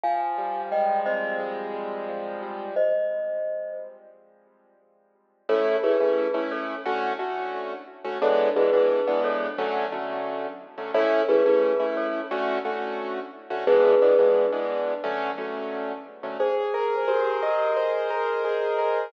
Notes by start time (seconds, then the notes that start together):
0.04 F3 F5 G#5
0.38 G3
0.72 G#3 D#5 G5
1.06 C4 C5 D#5
1.40 G#3
1.74 G3
2.08 F3
2.42 G3
2.76 C5 D#5
5.49 A3 C#4 E4 A4 C#5
5.83 A3 C#4 E4 G#4 B4
6.00 A3 C#4 E4
6.34 A3 C#4 E4
6.51 A4 C#5
6.86 D3 A3 C#4 F#4
7.19 D3 A3 C#4 F#4
8.05 D3 A3 C#4 F#4
8.22 E3 G#3 B3 D4 A4 C#5
8.56 E3 G#3 B3 D4 G#4 B4
8.73 E3 G#3 B3 D4
9.07 E3 G#3 B3 D4
9.24 A4 C#5
9.58 D3 F#3 A3 C#4
9.92 D3 F#3 A3 C#4
10.78 D3 F#3 A3 C#4
10.94 A3 C#4 E4 A4 C#5
11.29 A3 C#4 E4 G#4 B4
11.46 A3 C#4 E4
11.80 A3 C#4 E4
11.97 A4 C#5
12.31 D3 A3 C#4 F#4
12.65 D3 A3 C#4 F#4
13.50 D3 A3 C#4 F#4
13.67 E3 G#3 B3 D4 G#4 B4
14.02 E3 G#3 B3 D4
14.19 E3 G#3 B3 D4
14.52 E3 G#3 B3 D4
15.04 D3 F#3 A3 C#4
15.38 D3 F#3 A3 C#4
16.23 D3 F#3 A3 C#4
16.40 G#4 C5
16.74 A#4
17.08 G4 A#4 C5
17.42 G4 A#4 D#5
17.76 C5
18.11 A#4
18.45 G#4
18.79 A#4